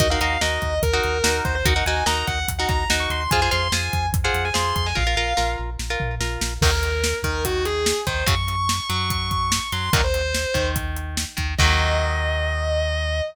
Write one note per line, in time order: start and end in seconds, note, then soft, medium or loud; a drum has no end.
0.00 0.17 D#2 medium
0.00 0.08 D#4 medium
0.00 0.08 F#4 medium
0.00 0.08 A#4 medium
0.00 0.10 D#5 medium
0.00 kick loud
0.00 closed hi-hat loud
0.10 0.20 D#4 medium
0.10 0.20 F#4 medium
0.10 0.20 A#4 medium
0.10 0.20 F5 medium
0.21 0.38 D#2 medium
0.21 0.38 D#4 medium
0.21 0.38 F#4 medium
0.21 0.38 A#4 medium
0.21 0.39 F5 medium
0.21 closed hi-hat medium
0.41 0.59 D#2 medium
0.41 0.74 D#4 medium
0.41 0.74 F#4 medium
0.41 0.74 A#4 medium
0.41 0.78 D#5 medium
0.41 snare loud
0.62 0.80 D#2 medium
0.62 kick medium
0.62 closed hi-hat medium
0.82 1.00 D#2 medium
0.82 1.41 A#4 medium
0.82 kick loud
0.82 closed hi-hat loud
0.93 1.18 D#4 medium
0.93 1.18 F#4 medium
0.93 1.18 A#4 medium
1.03 1.22 D#2 medium
1.03 closed hi-hat medium
1.24 1.41 D#2 medium
1.24 1.57 D#4 medium
1.24 1.57 F#4 medium
1.24 1.57 A#4 medium
1.24 snare loud
1.45 1.63 D#2 medium
1.45 1.55 C5 medium
1.45 kick loud
1.45 closed hi-hat medium
1.55 1.65 C5 medium
1.65 1.82 D#2 medium
1.65 1.74 D#4 medium
1.65 1.74 F#4 loud
1.65 1.74 A#4 medium
1.65 1.85 F#5 medium
1.65 kick loud
1.65 closed hi-hat loud
1.76 1.84 D#4 medium
1.76 1.84 F#4 medium
1.76 1.84 A#4 medium
1.85 2.03 D#2 medium
1.85 2.04 D#4 medium
1.85 2.04 F#4 medium
1.85 2.04 A#4 medium
1.85 2.03 G#5 medium
1.85 closed hi-hat medium
2.06 2.24 D#2 medium
2.06 2.39 D#4 medium
2.06 2.39 F#4 medium
2.06 2.39 A#4 medium
2.06 2.25 A#5 medium
2.06 snare loud
2.27 2.45 D#2 medium
2.27 2.46 F#5 medium
2.27 kick medium
2.27 closed hi-hat medium
2.48 2.66 D#2 medium
2.48 kick medium
2.48 closed hi-hat loud
2.59 2.84 D#4 medium
2.59 2.84 F#4 medium
2.59 2.84 A#4 medium
2.59 2.68 F#5 medium
2.69 2.86 D#2 medium
2.69 2.88 A#5 medium
2.69 kick loud
2.69 closed hi-hat medium
2.90 3.07 D#2 medium
2.90 3.23 D#4 medium
2.90 3.23 F#4 medium
2.90 3.23 A#4 medium
2.90 snare loud
3.00 3.10 C#6 medium
3.10 3.27 D#2 medium
3.10 3.20 C6 medium
3.10 closed hi-hat medium
3.21 3.31 C6 medium
3.31 3.49 F2 medium
3.31 3.41 F4 medium
3.31 3.41 G#4 loud
3.31 3.41 C5 medium
3.31 3.48 G#5 loud
3.31 kick loud
3.31 closed hi-hat loud
3.42 3.50 F4 medium
3.42 3.50 G#4 medium
3.42 3.50 C5 medium
3.51 3.70 F2 medium
3.51 3.68 F4 medium
3.51 3.68 G#4 medium
3.51 3.68 C5 medium
3.51 3.71 C6 medium
3.51 closed hi-hat medium
3.72 3.89 F2 medium
3.72 4.06 F4 medium
3.72 4.06 G#4 medium
3.72 4.06 C5 medium
3.72 4.06 G#5 medium
3.72 snare loud
3.93 4.11 F2 medium
3.93 kick medium
3.93 closed hi-hat medium
4.12 4.30 F2 medium
4.12 kick loud
4.12 closed hi-hat loud
4.24 4.49 F4 medium
4.24 4.49 G#4 medium
4.24 4.49 C5 medium
4.24 4.43 F#5 medium
4.34 4.51 F2 medium
4.34 closed hi-hat medium
4.45 4.55 G#5 medium
4.54 4.73 F2 medium
4.54 4.87 F4 medium
4.54 4.87 G#4 medium
4.54 4.87 C5 medium
4.54 4.74 C6 medium
4.54 snare loud
4.76 4.94 F2 medium
4.76 4.86 C6 medium
4.76 kick medium
4.76 closed hi-hat medium
4.86 4.96 G#5 medium
4.95 5.15 A#1 medium
4.95 5.04 F4 medium
4.95 5.04 A#4 medium
4.95 5.50 F5 medium
4.95 kick loud
5.07 5.15 F4 medium
5.07 5.15 A#4 medium
5.17 5.34 A#1 medium
5.17 5.34 F4 medium
5.17 5.34 A#4 medium
5.37 5.56 A#1 medium
5.37 5.70 F4 medium
5.37 5.70 A#4 medium
5.37 snare medium
5.59 5.77 A#1 medium
5.79 5.97 A#1 medium
5.79 snare medium
5.90 6.15 F4 medium
5.90 6.15 A#4 medium
6.00 6.19 A#1 medium
6.00 floor tom loud
6.20 6.38 A#1 medium
6.20 6.54 F4 medium
6.20 6.54 A#4 medium
6.20 snare loud
6.41 6.59 A#1 medium
6.41 snare loud
6.61 7.14 D#2 loud
6.61 6.71 D#3 medium
6.61 6.71 F#3 medium
6.61 6.71 A#3 medium
6.61 7.15 A#4 loud
6.61 kick loud
6.61 crash loud
6.83 closed hi-hat medium
7.04 snare loud
7.23 7.93 D#2 medium
7.23 7.94 D#3 medium
7.23 7.43 A#4 medium
7.23 kick medium
7.23 closed hi-hat medium
7.45 7.64 F#4 medium
7.45 kick medium
7.45 closed hi-hat loud
7.65 8.00 G#4 medium
7.65 closed hi-hat medium
7.86 snare loud
8.07 8.24 D#2 medium
8.07 8.24 D#3 medium
8.07 8.24 C5 medium
8.07 kick loud
8.07 closed hi-hat medium
8.26 8.80 F#2 loud
8.26 8.35 C#3 loud
8.26 8.35 F#3 medium
8.26 8.87 C#6 loud
8.26 kick loud
8.26 closed hi-hat loud
8.48 closed hi-hat medium
8.69 snare loud
8.89 9.60 F#2 medium
8.89 9.60 F#3 medium
8.89 9.10 C#6 medium
8.89 closed hi-hat medium
9.10 9.30 C#6 medium
9.10 kick loud
9.10 closed hi-hat loud
9.31 9.68 C#6 medium
9.31 kick medium
9.31 closed hi-hat medium
9.52 snare loud
9.72 9.90 F#2 medium
9.72 9.90 F#3 medium
9.72 9.92 C6 loud
9.72 closed hi-hat medium
9.93 10.46 D#2 medium
9.93 10.01 A#2 medium
9.93 10.01 D#3 medium
9.93 10.01 F#3 medium
9.93 10.03 A#4 loud
9.93 kick loud
9.93 closed hi-hat loud
10.04 10.66 C5 loud
10.14 closed hi-hat medium
10.34 snare loud
10.54 11.25 D#2 medium
10.54 11.24 D#3 medium
10.54 kick loud
10.54 closed hi-hat medium
10.76 kick loud
10.76 closed hi-hat loud
10.96 closed hi-hat medium
11.17 snare loud
11.37 11.56 D#2 medium
11.37 11.54 D#3 medium
11.37 kick medium
11.37 closed hi-hat medium
11.58 13.22 D#2 loud
11.58 13.22 D#3 loud
11.58 13.22 F#3 loud
11.58 13.22 A#3 medium
11.58 13.21 D#5 loud
11.58 kick loud
11.58 crash loud